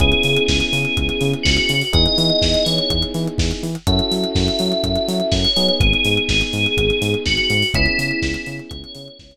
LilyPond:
<<
  \new Staff \with { instrumentName = "Tubular Bells" } { \time 4/4 \key cis \minor \tempo 4 = 124 gis'4 gis'2 fis'4 | dis''4. cis''4 r4. | e''4 e''2 cis''4 | gis'4 gis'2 fis'4 |
e'2 cis''4. r8 | }
  \new Staff \with { instrumentName = "Electric Piano 1" } { \time 4/4 \key cis \minor <b cis' e' gis'>1 | <b dis' e' gis'>1 | <cis' e' fis' a'>2.~ <cis' e' fis' a'>8 <b dis' gis'>8~ | <b dis' gis'>1 |
<b cis' e' gis'>1 | }
  \new Staff \with { instrumentName = "Synth Bass 1" } { \clef bass \time 4/4 \key cis \minor cis,8 cis8 cis,8 cis8 cis,8 cis8 cis,8 cis8 | e,8 e8 e,8 e8 e,8 e8 e,8 e8 | fis,8 fis8 fis,8 fis8 fis,8 fis8 fis,8 fis8 | gis,,8 gis,8 gis,,8 gis,8 gis,,8 gis,8 gis,,8 gis,8 |
cis,8 cis8 cis,8 cis8 cis,8 cis8 cis,8 r8 | }
  \new DrumStaff \with { instrumentName = "Drums" } \drummode { \time 4/4 <hh bd>16 hh16 hho16 hh16 <bd sn>16 hh16 hho16 hh16 <hh bd>16 hh16 hho16 hh16 <bd sn>16 hh16 hho16 hho16 | <hh bd>16 hh16 hho16 hh16 <bd sn>16 hh16 hho16 hh16 <hh bd>16 hh16 hho16 hh16 <bd sn>16 hh16 hho16 hh16 | <hh bd>16 hh16 hho16 hh16 <bd sn>16 hh16 hho16 hh16 <hh bd>16 hh16 hho16 hh16 <bd sn>16 hh16 hho16 hh16 | <hh bd>16 hh16 hho16 hh16 <bd sn>16 hh16 hho16 hh16 <hh bd>16 hh16 hho16 hh16 <bd sn>16 hh16 hho16 hho16 |
<hh bd>16 hh16 hho16 hh16 <bd sn>16 hh16 hho16 hh16 <hh bd>16 hh16 hho16 hh16 <bd sn>16 hh8. | }
>>